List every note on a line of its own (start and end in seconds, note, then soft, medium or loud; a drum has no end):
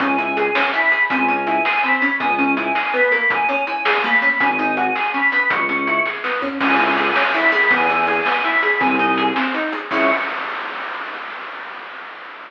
0.00 0.50 C#2 loud
0.00 0.17 C#4 medium
0.00 0.32 G#5 medium
0.00 kick loud
0.00 closed hi-hat loud
0.18 0.35 E4 medium
0.18 closed hi-hat medium
0.37 0.53 G#4 medium
0.37 0.71 G#5 medium
0.37 closed hi-hat loud
0.55 0.72 C#4 medium
0.55 snare loud
0.73 0.90 E4 medium
0.73 1.09 B5 medium
0.73 closed hi-hat medium
0.92 1.08 G#4 medium
0.92 closed hi-hat medium
1.09 1.59 C#2 loud
1.09 1.27 C4 medium
1.09 1.39 G#5 loud
1.09 kick loud
1.09 closed hi-hat loud
1.28 1.45 C#4 medium
1.28 closed hi-hat medium
1.47 1.63 E4 medium
1.47 1.82 G#5 loud
1.47 closed hi-hat medium
1.65 1.81 G#4 medium
1.65 snare loud
1.82 2.00 C4 medium
1.82 2.13 B5 medium
1.82 closed hi-hat medium
2.02 2.18 C#4 medium
2.02 closed hi-hat medium
2.19 2.70 C#2 loud
2.19 2.37 B3 medium
2.19 2.50 G#5 loud
2.19 kick loud
2.19 closed hi-hat loud
2.39 2.55 C#4 medium
2.39 closed hi-hat medium
2.57 2.73 E4 medium
2.57 2.89 G#5 medium
2.57 closed hi-hat loud
2.75 2.92 G#4 medium
2.75 snare loud
2.94 3.10 B3 medium
2.94 3.28 B5 medium
2.94 closed hi-hat medium
3.12 3.47 A#3 medium
3.12 closed hi-hat medium
3.30 3.62 G#5 loud
3.30 kick loud
3.30 closed hi-hat loud
3.49 3.65 C#4 medium
3.49 closed hi-hat medium
3.67 3.84 E4 medium
3.67 4.01 G#5 medium
3.67 closed hi-hat medium
3.85 4.02 G#4 medium
3.85 snare loud
4.04 4.20 A#3 medium
4.04 4.39 B5 medium
4.04 closed hi-hat medium
4.22 4.38 C#4 medium
4.22 closed hi-hat medium
4.40 4.90 G#1 loud
4.40 4.57 C#4 medium
4.40 4.71 G#5 medium
4.40 kick loud
4.40 closed hi-hat loud
4.59 4.75 D#4 medium
4.59 closed hi-hat medium
4.77 4.94 F#4 medium
4.77 5.09 G#5 medium
4.77 closed hi-hat medium
4.95 5.12 G#4 medium
4.95 snare loud
5.14 5.30 C#4 medium
5.14 5.46 B5 medium
5.14 closed hi-hat medium
5.32 5.67 B3 medium
5.32 closed hi-hat medium
5.49 6.00 C#2 loud
5.49 6.02 C#6 loud
5.49 kick loud
5.49 closed hi-hat loud
5.69 5.85 C#4 medium
5.69 closed hi-hat medium
5.87 6.04 E4 medium
5.87 closed hi-hat medium
6.05 6.22 G#4 medium
6.05 kick medium
6.05 snare medium
6.24 6.40 B3 medium
6.24 snare loud
6.42 6.58 C#4 medium
6.42 floor tom loud
6.60 7.10 C#2 loud
6.60 6.77 C#4 medium
6.60 6.91 G#5 loud
6.60 kick loud
6.60 crash loud
6.79 6.95 E4 medium
6.79 closed hi-hat medium
6.95 7.14 G#4 medium
6.95 7.31 G#5 medium
6.95 closed hi-hat medium
7.16 7.32 C#4 medium
7.16 snare loud
7.34 7.51 E4 medium
7.34 7.71 B5 medium
7.34 closed hi-hat medium
7.52 7.69 G#4 medium
7.52 closed hi-hat medium
7.70 8.20 E2 loud
7.70 7.87 B3 medium
7.70 8.02 G#5 loud
7.70 kick loud
7.70 closed hi-hat loud
7.89 8.06 E4 medium
7.89 closed hi-hat medium
8.07 8.24 G#4 medium
8.07 8.40 G#5 medium
8.07 closed hi-hat medium
8.26 8.42 B3 medium
8.26 snare loud
8.44 8.61 E4 medium
8.44 8.78 B5 medium
8.44 closed hi-hat medium
8.62 8.79 G#4 medium
8.62 closed hi-hat medium
8.79 9.31 C2 loud
8.79 8.97 C4 medium
8.79 9.25 G#5 loud
8.79 kick loud
8.79 closed hi-hat loud
8.99 9.16 D#4 medium
8.99 closed hi-hat medium
9.17 9.34 G#4 medium
9.17 closed hi-hat loud
9.36 9.52 C4 medium
9.36 snare loud
9.54 9.71 D#4 medium
9.54 closed hi-hat medium
9.72 9.89 G#4 medium
9.72 closed hi-hat medium
9.90 10.10 C#2 loud
9.90 10.10 C#4 loud
9.90 10.10 E4 loud
9.90 10.10 G#4 loud
9.90 10.10 C#6 loud
9.90 kick loud
9.90 crash loud